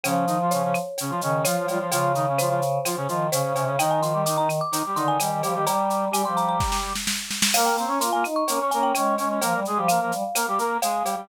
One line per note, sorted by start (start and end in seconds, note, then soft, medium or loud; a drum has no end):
0.03 0.25 C#3 medium
0.03 0.79 F3 medium
0.03 0.25 C#4 medium
0.03 cowbell medium
0.03 claves medium
0.03 shaker medium
0.27 0.38 D#3 medium
0.27 0.38 D#4 medium
0.27 shaker medium
0.42 0.53 F3 medium
0.42 0.53 F4 medium
0.51 0.63 C#3 medium
0.51 0.63 C#4 medium
0.51 1.36 C#5 medium
0.51 shaker medium
0.63 0.75 C#3 medium
0.63 0.75 C#4 medium
0.74 claves medium
0.74 shaker medium
0.98 1.11 C#3 medium
0.98 1.11 C#4 medium
0.98 cowbell medium
0.98 shaker medium
1.10 1.21 F3 medium
1.10 1.21 F4 medium
1.21 1.45 C#3 medium
1.21 1.42 D#3 medium
1.21 1.45 C#4 medium
1.21 shaker medium
1.45 1.66 F3 medium
1.45 1.56 F3 medium
1.45 1.66 F4 medium
1.45 1.87 C#5 medium
1.45 cowbell medium
1.45 claves medium
1.45 shaker loud
1.57 1.68 F3 medium
1.67 1.79 F3 medium
1.67 1.78 G3 medium
1.67 1.79 F4 medium
1.67 cowbell medium
1.67 shaker medium
1.79 1.91 F3 medium
1.79 1.91 F4 medium
1.91 2.79 C#3 medium
1.91 2.12 F3 medium
1.91 2.12 F4 medium
1.91 cowbell medium
1.91 shaker medium
2.15 2.26 D#3 medium
2.15 2.26 D#4 medium
2.15 shaker medium
2.29 2.40 C#3 medium
2.29 2.40 C#4 medium
2.38 2.49 F3 medium
2.38 2.49 F4 medium
2.38 3.16 C5 medium
2.38 claves medium
2.38 shaker medium
2.49 2.60 F3 medium
2.49 2.60 F4 medium
2.62 shaker medium
2.85 2.96 F3 medium
2.85 2.96 F4 medium
2.85 cowbell medium
2.85 claves medium
2.85 shaker medium
2.96 3.08 C#3 medium
2.96 3.08 C#4 medium
3.08 3.30 D#3 medium
3.08 3.27 F3 medium
3.08 3.27 F4 medium
3.08 shaker medium
3.31 3.42 C#3 medium
3.31 3.53 C#3 medium
3.31 3.53 C#4 medium
3.31 3.71 C5 medium
3.31 cowbell medium
3.31 shaker loud
3.44 3.55 C#3 medium
3.54 3.67 C3 medium
3.54 3.65 C#3 medium
3.54 3.65 C#4 medium
3.54 cowbell medium
3.54 shaker medium
3.65 3.76 C#3 medium
3.65 3.78 C#3 medium
3.65 3.76 C#4 medium
3.78 4.61 D#3 medium
3.78 4.01 D#3 medium
3.78 4.01 D#4 medium
3.78 3.90 G5 medium
3.78 cowbell medium
3.78 claves medium
3.78 shaker medium
3.91 4.02 G#5 medium
4.02 4.13 F3 medium
4.02 4.13 F4 medium
4.02 4.21 C6 medium
4.02 shaker medium
4.13 4.24 G3 medium
4.13 4.24 G4 medium
4.26 4.37 D#3 medium
4.26 4.37 D#4 medium
4.26 4.37 D6 medium
4.26 shaker loud
4.37 4.48 D#3 medium
4.37 4.48 D#4 medium
4.37 4.49 A#5 medium
4.49 claves medium
4.49 shaker medium
4.61 4.94 D6 medium
4.72 4.83 D#3 medium
4.72 4.83 D#4 medium
4.72 cowbell medium
4.72 shaker medium
4.86 4.97 G3 medium
4.86 4.97 G4 medium
4.95 5.18 D3 medium
4.95 5.18 D#3 medium
4.95 5.18 D#4 medium
4.95 5.07 C6 medium
4.95 shaker medium
5.08 5.42 G#5 medium
5.19 5.30 D#3 medium
5.19 5.42 G3 medium
5.19 5.42 G4 medium
5.19 cowbell medium
5.19 claves medium
5.19 shaker medium
5.31 5.42 D#3 medium
5.43 5.55 F3 medium
5.43 5.54 G3 medium
5.43 5.54 G4 medium
5.43 cowbell medium
5.43 shaker medium
5.54 5.66 D#3 medium
5.54 5.65 G3 medium
5.54 5.65 G4 medium
5.66 6.05 G3 medium
5.66 6.09 G3 medium
5.66 6.05 G4 medium
5.66 6.11 A#5 medium
5.66 cowbell medium
5.66 shaker medium
5.90 shaker medium
6.11 6.22 G3 medium
6.11 6.25 G3 medium
6.11 6.22 G4 medium
6.11 6.25 G#5 medium
6.11 claves medium
6.11 shaker medium
6.24 6.57 F3 medium
6.24 6.93 G3 medium
6.24 6.93 G4 medium
6.24 6.36 C6 medium
6.37 6.48 A#5 medium
6.37 shaker medium
6.49 6.78 A#5 medium
6.60 kick medium
6.60 snare medium
6.72 snare medium
6.95 snare medium
7.07 snare medium
7.31 snare medium
7.42 snare loud
7.54 7.69 A#3 medium
7.54 7.76 A#3 medium
7.54 7.76 A#4 loud
7.54 7.65 F5 medium
7.54 crash loud
7.54 cowbell medium
7.54 claves medium
7.66 7.77 G5 medium
7.70 7.85 A#3 medium
7.77 7.89 C4 medium
7.77 7.89 C5 medium
7.77 8.00 A#5 medium
7.77 shaker medium
7.85 8.00 C#4 medium
7.85 7.99 C#4 medium
7.85 7.99 C#5 medium
7.99 8.10 A#3 medium
7.99 8.24 F4 medium
7.99 8.10 A#4 medium
7.99 8.12 C6 medium
7.99 shaker loud
8.13 8.24 A#3 medium
8.13 8.24 A#4 medium
8.13 8.24 G#5 medium
8.24 8.44 D#4 medium
8.24 claves medium
8.24 shaker medium
8.36 8.69 C#6 medium
8.48 8.60 A#3 medium
8.48 8.59 C#4 medium
8.48 8.60 A#4 medium
8.48 cowbell medium
8.48 shaker medium
8.60 8.71 C#4 medium
8.60 8.71 C#5 medium
8.71 8.92 A#3 medium
8.71 8.93 C#4 medium
8.71 8.92 A#4 medium
8.71 8.82 G#5 medium
8.71 shaker medium
8.83 9.14 G5 medium
8.95 9.17 G#3 medium
8.95 9.15 C#4 medium
8.95 9.15 C#5 medium
8.95 cowbell medium
8.95 claves medium
8.95 shaker medium
9.18 9.39 G#3 medium
9.18 9.29 C#4 medium
9.18 9.29 C#5 medium
9.18 cowbell medium
9.18 shaker medium
9.29 9.40 C#4 medium
9.29 9.40 C#5 medium
9.41 9.53 F3 medium
9.41 9.60 A#3 medium
9.41 9.60 A#4 medium
9.41 cowbell medium
9.41 shaker medium
9.54 9.65 G3 medium
9.65 9.78 G#3 medium
9.65 9.78 G#4 medium
9.65 shaker medium
9.76 9.98 F3 medium
9.76 9.88 G3 medium
9.76 9.88 G4 medium
9.88 10.00 A#3 medium
9.88 10.00 A#4 medium
9.88 10.66 F5 medium
9.88 claves medium
9.88 shaker medium
10.00 10.11 F3 medium
10.00 10.12 A#3 medium
10.00 10.12 A#4 medium
10.12 10.23 G3 medium
10.12 shaker medium
10.35 10.46 A#3 medium
10.35 10.46 A#4 medium
10.35 cowbell medium
10.35 claves medium
10.35 shaker loud
10.48 10.59 G3 medium
10.48 10.59 G4 medium
10.58 10.78 A#3 medium
10.58 10.78 A#4 medium
10.58 shaker medium
10.82 11.03 G#3 medium
10.82 11.03 G#4 medium
10.82 11.24 F5 medium
10.82 cowbell medium
10.82 shaker medium
11.04 11.15 G3 medium
11.04 11.15 G4 medium
11.04 cowbell medium
11.04 shaker medium
11.16 11.27 G3 medium
11.16 11.27 G4 medium